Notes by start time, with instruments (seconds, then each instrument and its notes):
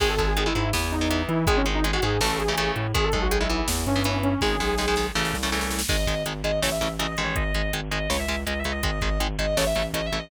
0.00 synth bass 1 G#1, overdriven guitar D#3 G#3, lead 2 (sawtooth) G#4, kick, crash
0.09 lead 2 (sawtooth) A4
0.18 overdriven guitar D#3 G#3, lead 2 (sawtooth) A4, kick, closed hi-hat
0.28 lead 2 (sawtooth) G#4
0.37 overdriven guitar D#3 G#3, lead 2 (sawtooth) G#4, closed hi-hat
0.46 overdriven guitar D#3 G#3, lead 2 (sawtooth) E4
0.55 synth bass 1 G#2, overdriven guitar D#3 G#3, lead 2 (sawtooth) E4, closed hi-hat
0.73 synth bass 1 E2, overdriven guitar E3 B3, snare
0.92 lead 2 (sawtooth) D#4, closed hi-hat
1.01 overdriven guitar E3 B3
1.10 overdriven guitar E3 B3, closed hi-hat
1.28 synth bass 1 E3, lead 2 (sawtooth) E4, closed hi-hat
1.47 synth bass 1 G#1, overdriven guitar D#3 G#3, lead 2 (sawtooth) G#4, kick, closed hi-hat
1.56 lead 2 (sawtooth) C#4
1.66 overdriven guitar D#3 G#3, closed hi-hat
1.75 lead 2 (sawtooth) D#4
1.84 overdriven guitar D#3 G#3, closed hi-hat
1.93 overdriven guitar D#3 G#3, lead 2 (sawtooth) F#4
2.02 synth bass 1 G#2, overdriven guitar D#3 G#3, lead 2 (sawtooth) G#4, closed hi-hat
2.21 synth bass 1 A1, overdriven guitar C#3 E3 A3, lead 2 (sawtooth) A4, snare
2.39 lead 2 (sawtooth) G#4, closed hi-hat
2.48 overdriven guitar C#3 E3 A3
2.57 overdriven guitar C#3 E3 A3, closed hi-hat
2.76 synth bass 1 A2, closed hi-hat
2.94 synth bass 1 G#1, overdriven guitar D#3 G#3, lead 2 (sawtooth) G#4, kick, closed hi-hat
3.04 lead 2 (sawtooth) A4
3.12 synth bass 1 B1, overdriven guitar D#3 G#3, lead 2 (sawtooth) A4, kick, closed hi-hat
3.22 lead 2 (sawtooth) F#4
3.31 overdriven guitar D#3 G#3, lead 2 (sawtooth) G#4, closed hi-hat
3.40 overdriven guitar D#3 G#3, lead 2 (sawtooth) E4
3.49 overdriven guitar E3 B3, lead 2 (sawtooth) E4, closed hi-hat
3.68 synth bass 1 E2, snare
3.86 synth bass 1 G2, lead 2 (sawtooth) C#4, closed hi-hat
3.96 overdriven guitar E3 B3
4.04 overdriven guitar E3 B3, closed hi-hat
4.23 lead 2 (sawtooth) C#4, closed hi-hat
4.41 synth bass 1 G#1, overdriven guitar D#3 G#3, lead 2 (sawtooth) G#4, kick, snare
4.60 synth bass 1 B1, overdriven guitar D#3 G#3, snare
4.78 overdriven guitar D#3 G#3, snare
4.88 overdriven guitar D#3 G#3
4.96 overdriven guitar D#3 G#3, snare
5.15 synth bass 1 A1, overdriven guitar C#3 E3 A3, snare
5.25 snare
5.34 synth bass 1 C2, snare
5.43 overdriven guitar C#3 E3 A3, snare
5.52 overdriven guitar C#3 E3 A3, snare
5.61 snare
5.71 snare
5.79 snare
5.88 synth bass 1 G#1, overdriven guitar D#3 G#3, distortion guitar D#5, kick, crash
6.06 synth bass 1 G#1, overdriven guitar D#3 G#3, kick, closed hi-hat
6.26 synth bass 1 G#1, overdriven guitar D#3 G#3, closed hi-hat
6.44 synth bass 1 G#1, overdriven guitar D#3 G#3, distortion guitar D#5, closed hi-hat
6.62 synth bass 1 A1, overdriven guitar C#3 E3 A3, distortion guitar C#5, snare
6.72 distortion guitar E5
6.81 synth bass 1 A1, overdriven guitar C#3 E3 A3, closed hi-hat
6.99 synth bass 1 A1, overdriven guitar C#3 E3 A3, distortion guitar D#5, closed hi-hat
7.11 distortion guitar D#5
7.17 synth bass 1 A1, overdriven guitar D#3 G#3, closed hi-hat
7.24 distortion guitar C#5
7.36 synth bass 1 G#1, distortion guitar D#5, kick, closed hi-hat
7.54 synth bass 1 G#1, overdriven guitar D#3 G#3, closed hi-hat
7.73 synth bass 1 G#1, overdriven guitar D#3 G#3, closed hi-hat
7.91 synth bass 1 G#1, overdriven guitar D#3 G#3, distortion guitar D#5, closed hi-hat
8.10 synth bass 1 C#2, overdriven guitar C#3 G#3, distortion guitar C#5, snare
8.19 distortion guitar E5
8.28 synth bass 1 C#2, overdriven guitar C#3 G#3, closed hi-hat
8.47 synth bass 1 C#2, overdriven guitar C#3 G#3, distortion guitar D#5, closed hi-hat
8.59 distortion guitar E5
8.64 synth bass 1 C#2, overdriven guitar C#3 G#3, closed hi-hat
8.71 distortion guitar D#5
8.83 synth bass 1 G#1, overdriven guitar D#3 G#3, distortion guitar D#5, kick, closed hi-hat
9.01 synth bass 1 G#1, overdriven guitar D#3 G#3, kick, closed hi-hat
9.20 synth bass 1 G#1, overdriven guitar D#3 G#3, closed hi-hat
9.39 synth bass 1 G#1, overdriven guitar D#3 G#3, distortion guitar D#5, closed hi-hat
9.57 synth bass 1 A1, overdriven guitar C#3 E3 A3, distortion guitar C#5, snare
9.66 distortion guitar E5
9.75 synth bass 1 A1, overdriven guitar C#3 E3 A3, closed hi-hat
9.93 synth bass 1 A1, overdriven guitar C#3 E3 A3, distortion guitar D#5, closed hi-hat
10.06 distortion guitar E5
10.12 synth bass 1 A1, overdriven guitar C#3 E3 A3, closed hi-hat
10.19 distortion guitar D#5